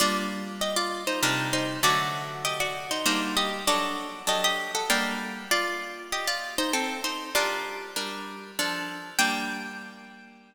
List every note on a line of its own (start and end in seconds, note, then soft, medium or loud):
0.00 1.11 G3 medium
0.00 1.11 A#3 loud
0.00 1.11 D4 medium
0.00 0.56 F4 medium
0.00 0.56 D5 medium
0.61 0.76 G4 medium
0.61 0.76 D#5 medium
0.76 1.04 F4 medium
0.76 1.04 D5 medium
1.07 1.22 D#4 soft
1.07 1.22 C5 medium
1.23 1.78 C3 medium
1.23 1.78 G3 loud
1.23 1.51 D4 medium
1.23 1.78 D#4 loud
1.23 1.51 A#4 medium
1.53 1.80 D#4 medium
1.53 1.80 C5 medium
1.83 2.93 D3 loud
1.83 2.93 F#3 loud
1.83 2.93 A3 medium
1.83 2.38 F#4 medium
1.83 2.38 D5 medium
2.45 2.59 G4 medium
2.45 2.59 D#5 medium
2.60 2.86 F#4 medium
2.60 2.86 D5 medium
2.91 3.05 D#4 medium
2.91 3.05 C5 medium
3.06 3.61 G3 medium
3.06 3.61 A#3 medium
3.06 3.61 D4 loud
3.06 3.36 D#4 medium
3.06 3.36 C5 medium
3.37 3.65 G4 medium
3.37 3.65 D#5 medium
3.67 4.23 F#3 loud
3.67 4.23 D4 loud
3.67 4.26 F#4 medium
3.67 4.23 A4 loud
3.67 4.26 D5 medium
4.27 4.82 F#3 medium
4.27 4.82 D4 medium
4.27 4.43 G4 medium
4.27 4.82 A4 medium
4.27 4.43 D#5 medium
4.44 4.72 G4 medium
4.44 4.72 D#5 medium
4.75 4.89 A4 medium
4.75 4.89 F#5 medium
4.90 5.45 G3 loud
4.90 5.45 A#3 loud
4.90 5.45 D4 medium
4.90 5.48 A#4 medium
4.90 5.48 G5 medium
5.51 6.08 F4 medium
5.51 6.08 D5 medium
6.12 6.27 G4 medium
6.12 6.27 D#5 medium
6.27 6.55 F4 medium
6.27 6.55 D5 medium
6.58 6.73 D#4 medium
6.58 6.73 C5 medium
6.73 7.01 C4 medium
6.73 7.01 A4 medium
7.04 7.30 D#4 medium
7.04 7.30 C5 medium
7.35 7.91 G3 loud
7.35 7.91 D4 loud
7.35 7.93 F4 medium
7.35 7.91 A#4 medium
7.35 7.93 D5 medium
7.96 8.51 G3 medium
7.96 8.51 D4 medium
7.96 8.51 A#4 medium
8.59 9.14 F3 loud
8.59 9.14 D4 loud
8.59 9.14 A4 medium
9.19 10.55 G3 loud
9.19 10.55 A#3 loud
9.19 10.55 D4 loud
9.19 10.55 G5 loud